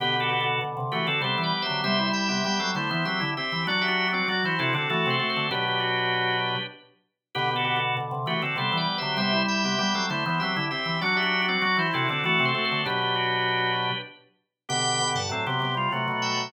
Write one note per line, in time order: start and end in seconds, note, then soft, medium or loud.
0.00 0.58 B2 loud
0.00 0.99 D3 loud
0.00 0.15 B3 medium
0.00 0.15 G4 medium
0.00 0.21 G4 loud
0.00 0.21 B4 loud
0.15 0.29 B3 medium
0.15 0.29 G4 medium
0.20 0.40 F#4 medium
0.20 0.40 A4 loud
0.30 0.45 B3 medium
0.30 0.45 G4 medium
0.40 0.60 F#4 medium
0.40 0.60 A4 loud
0.61 0.76 B2 medium
0.77 0.91 C3 medium
0.92 1.08 E3 medium
0.92 1.07 A3 medium
0.92 1.07 F#4 medium
0.92 1.06 G4 medium
0.92 1.06 B4 loud
1.07 1.21 D3 medium
1.07 1.21 C4 medium
1.07 1.22 F#4 medium
1.07 1.21 A4 medium
1.21 1.36 C3 medium
1.21 1.63 G3 medium
1.21 1.83 B3 medium
1.21 1.83 G4 medium
1.21 1.41 A4 medium
1.21 1.41 C5 loud
1.38 1.52 E3 loud
1.43 1.63 B4 medium
1.43 1.63 D5 medium
1.62 1.82 C5 medium
1.62 1.82 E5 loud
1.66 1.85 D3 medium
1.66 1.81 F#3 medium
1.84 2.11 C3 medium
1.84 2.42 G3 loud
1.84 1.98 B3 medium
1.84 1.98 G4 medium
1.84 2.09 C5 loud
1.84 2.09 E5 loud
1.99 2.29 G3 medium
1.99 2.29 E4 medium
2.13 2.71 E5 medium
2.13 2.71 G5 loud
2.29 2.44 C3 medium
2.29 2.43 B3 medium
2.29 2.43 G4 medium
2.44 2.59 G3 medium
2.44 2.70 G3 medium
2.44 2.60 B3 medium
2.44 2.60 G4 medium
2.59 2.75 F#3 loud
2.59 2.74 C4 soft
2.59 2.74 A4 medium
2.75 2.89 D3 medium
2.75 2.91 A3 medium
2.75 2.90 E4 medium
2.75 2.90 C5 medium
2.90 3.06 E3 loud
2.90 3.04 B3 medium
2.90 3.05 E4 medium
2.90 3.05 C5 medium
3.05 3.20 F#3 loud
3.05 3.22 C4 medium
3.05 3.30 G4 medium
3.05 3.30 E5 medium
3.20 3.36 D3 loud
3.20 3.35 E4 medium
3.37 3.64 C4 medium
3.37 3.66 G4 medium
3.37 3.66 E5 medium
3.52 3.67 E3 loud
3.67 4.19 F#3 loud
3.67 3.86 D4 loud
3.67 4.07 D4 loud
3.67 3.86 F#4 loud
3.67 3.83 F#4 medium
3.67 3.83 D5 medium
3.81 4.11 G4 medium
3.81 4.11 E5 medium
3.88 4.07 D4 loud
3.88 4.07 F#4 loud
4.08 4.27 D4 medium
4.08 4.27 F#4 loud
4.13 4.27 C4 medium
4.13 4.28 F#4 medium
4.13 4.28 D5 medium
4.28 4.42 F#3 loud
4.28 4.43 F#4 medium
4.28 4.55 F#4 loud
4.28 4.43 D5 medium
4.44 4.59 E3 medium
4.44 4.60 E4 medium
4.44 4.60 C5 medium
4.59 4.74 C3 loud
4.59 4.73 C4 medium
4.59 4.74 D4 medium
4.59 4.74 E4 medium
4.59 4.74 F#4 loud
4.59 4.73 A4 medium
4.73 4.88 D3 loud
4.73 4.89 C4 medium
4.73 4.89 D4 medium
4.73 4.89 F#4 medium
4.73 4.89 A4 medium
4.90 5.05 E3 loud
4.90 5.16 A3 medium
4.90 5.09 F#4 loud
4.90 5.16 F#4 medium
4.90 5.09 A4 loud
5.06 5.20 C3 loud
5.06 5.47 C4 medium
5.10 5.30 A4 medium
5.10 5.30 C5 loud
5.20 5.46 A3 medium
5.20 5.46 F#4 medium
5.30 5.49 A4 medium
5.30 5.49 C5 loud
5.36 5.51 D3 medium
5.51 6.54 B2 loud
5.51 6.57 F#3 medium
5.51 6.57 D4 medium
5.51 5.65 G4 medium
5.51 6.63 G4 loud
5.51 6.63 B4 loud
5.68 5.82 G4 medium
5.80 6.37 F#4 medium
7.35 7.95 B2 loud
7.35 8.34 D3 loud
7.35 7.50 B3 medium
7.35 7.54 G4 loud
7.35 7.50 G4 medium
7.35 7.54 B4 loud
7.51 7.64 B3 medium
7.51 7.64 G4 medium
7.56 7.75 F#4 medium
7.56 7.75 A4 loud
7.65 7.79 B3 medium
7.65 7.79 G4 medium
7.76 7.96 F#4 medium
7.76 7.96 A4 loud
7.97 8.11 B2 medium
8.11 8.26 C3 medium
8.26 8.41 E3 medium
8.26 8.42 A3 medium
8.26 8.42 F#4 medium
8.26 8.41 G4 medium
8.26 8.41 B4 loud
8.42 8.56 D3 medium
8.42 8.57 C4 medium
8.42 8.57 F#4 medium
8.42 8.57 A4 medium
8.56 8.70 C3 medium
8.56 8.99 G3 medium
8.56 9.17 B3 medium
8.56 9.17 G4 medium
8.56 8.77 A4 medium
8.56 8.77 C5 loud
8.72 8.87 E3 loud
8.77 8.97 B4 medium
8.77 8.97 D5 medium
8.98 9.16 D3 medium
8.98 9.17 C5 medium
8.98 9.17 E5 loud
9.02 9.17 F#3 medium
9.17 9.44 C3 medium
9.17 9.75 G3 loud
9.17 9.32 B3 medium
9.17 9.32 G4 medium
9.17 9.43 C5 loud
9.17 9.43 E5 loud
9.33 9.63 G3 medium
9.33 9.63 E4 medium
9.48 10.06 E5 medium
9.48 10.06 G5 loud
9.64 9.79 C3 medium
9.64 9.78 B3 medium
9.64 9.78 G4 medium
9.78 9.94 G3 medium
9.78 10.05 G3 medium
9.78 9.93 B3 medium
9.78 9.93 G4 medium
9.94 10.09 F#3 loud
9.94 10.09 C4 soft
9.94 10.09 A4 medium
10.10 10.24 D3 medium
10.10 10.24 A3 medium
10.10 10.25 E4 medium
10.10 10.25 C5 medium
10.26 10.40 E3 loud
10.26 10.40 B3 medium
10.26 10.41 E4 medium
10.26 10.41 C5 medium
10.40 10.56 F#3 loud
10.40 10.57 C4 medium
10.40 10.65 G4 medium
10.40 10.65 E5 medium
10.56 10.71 D3 loud
10.56 10.71 E4 medium
10.71 10.98 C4 medium
10.71 11.00 G4 medium
10.71 11.00 E5 medium
10.86 11.00 E3 loud
11.01 11.54 F#3 loud
11.01 11.22 D4 loud
11.01 11.41 D4 loud
11.01 11.16 F#4 medium
11.01 11.22 F#4 loud
11.01 11.16 D5 medium
11.17 11.46 G4 medium
11.17 11.46 E5 medium
11.23 11.42 D4 loud
11.23 11.42 F#4 loud
11.42 11.62 D4 medium
11.42 11.62 F#4 loud
11.48 11.63 C4 medium
11.48 11.62 F#4 medium
11.48 11.62 D5 medium
11.61 11.77 F#3 loud
11.61 11.87 F#4 loud
11.61 11.77 F#4 medium
11.61 11.77 D5 medium
11.77 11.91 E3 medium
11.77 11.93 E4 medium
11.77 11.93 C5 medium
11.93 12.09 C3 loud
11.93 12.09 C4 medium
11.93 12.08 D4 medium
11.93 12.07 E4 medium
11.93 12.08 F#4 loud
11.93 12.09 A4 medium
12.08 12.24 D3 loud
12.08 12.25 C4 medium
12.08 12.22 D4 medium
12.08 12.23 D4 medium
12.08 12.23 F#4 medium
12.08 12.25 A4 medium
12.24 12.38 E3 loud
12.24 12.51 A3 medium
12.24 12.45 F#4 loud
12.24 12.51 F#4 medium
12.24 12.45 A4 loud
12.39 12.54 C3 loud
12.39 12.79 C4 medium
12.45 12.65 A4 medium
12.45 12.65 C5 loud
12.55 12.82 A3 medium
12.55 12.82 F#4 medium
12.65 12.85 A4 medium
12.65 12.85 C5 loud
12.72 12.86 D3 medium
12.85 13.90 B2 loud
12.85 13.92 F#3 medium
12.85 13.92 D4 medium
12.85 13.01 G4 medium
12.85 13.98 G4 loud
12.85 13.98 B4 loud
13.02 13.16 G4 medium
13.15 13.72 F#4 medium
14.69 15.00 B2 loud
14.69 15.28 D3 loud
14.69 15.19 B3 medium
14.69 15.19 G4 medium
14.69 15.09 G5 loud
14.69 15.09 B5 loud
15.00 15.15 B2 loud
15.15 15.30 G2 medium
15.15 15.30 F#5 medium
15.15 15.30 A5 loud
15.29 15.45 A2 medium
15.29 15.66 F#3 medium
15.29 15.46 C4 medium
15.29 15.46 A4 medium
15.47 15.61 C3 loud
15.47 15.60 B3 medium
15.47 15.60 G4 medium
15.60 15.87 C3 loud
15.60 15.75 B3 medium
15.60 15.75 G4 medium
15.75 15.89 G3 medium
15.75 15.92 F4 medium
15.91 16.08 C3 medium
15.91 16.30 F#3 medium
15.91 16.52 A3 medium
15.91 16.52 F#4 medium
16.08 16.45 B2 loud
16.22 16.48 E5 medium
16.22 16.48 G5 loud
16.37 16.51 F#3 medium